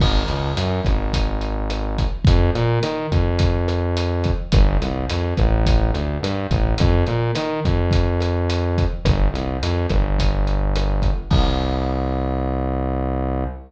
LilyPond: <<
  \new Staff \with { instrumentName = "Synth Bass 1" } { \clef bass \time 4/4 \key c \minor \tempo 4 = 106 aes,,8 cis,8 ges,8 aes,,2~ aes,,8 | f,8 bes,8 ees8 f,2~ f,8 | g,,8 c,8 f,8 a,,4 d,8 g,8 a,,8 | f,8 bes,8 ees8 f,2~ f,8 |
g,,8 c,8 f,8 g,,2~ g,,8 | c,1 | }
  \new DrumStaff \with { instrumentName = "Drums" } \drummode { \time 4/4 <cymc bd ss>8 hh8 hh8 <hh bd ss>8 <hh bd>8 hh8 <hh ss>8 <hh bd>8 | <hh bd>8 hh8 <hh ss>8 <hh bd>8 <hh bd>8 <hh ss>8 hh8 <hh bd>8 | <hh bd ss>8 hh8 hh8 <hh bd ss>8 <hh bd>8 hh8 <hh ss>8 <hh bd>8 | <hh bd>8 hh8 <hh ss>8 <hh bd>8 <hh bd>8 <hh ss>8 hh8 <hh bd>8 |
<hh bd ss>8 hh8 hh8 <hh bd ss>8 <hh bd>8 hh8 <hh ss>8 <hh bd>8 | <cymc bd>4 r4 r4 r4 | }
>>